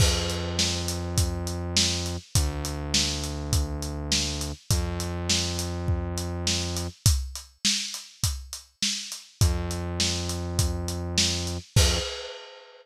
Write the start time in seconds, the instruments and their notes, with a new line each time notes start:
0.00 synth bass 1 F2, kick, crash
0.30 closed hi-hat
0.59 snare
0.88 closed hi-hat
1.18 kick, closed hi-hat
1.47 closed hi-hat
1.77 snare
2.06 closed hi-hat
2.35 synth bass 1 D2, kick, closed hi-hat
2.65 closed hi-hat
2.94 snare
3.24 closed hi-hat
3.53 kick, closed hi-hat
3.82 closed hi-hat
4.12 snare
4.41 closed hi-hat
4.70 synth bass 1 F2, kick, closed hi-hat
5.00 closed hi-hat
5.30 snare
5.59 closed hi-hat
5.88 kick
6.18 closed hi-hat
6.47 snare
6.76 closed hi-hat
7.06 kick, closed hi-hat
7.35 closed hi-hat
7.65 snare
7.94 closed hi-hat
8.24 kick, closed hi-hat
8.53 closed hi-hat
8.82 snare
9.12 closed hi-hat
9.41 synth bass 1 F2, kick, closed hi-hat
9.71 closed hi-hat
10.00 snare
10.29 closed hi-hat
10.59 kick, closed hi-hat
10.88 closed hi-hat
11.18 snare
11.47 closed hi-hat
11.76 synth bass 1 F2, kick, crash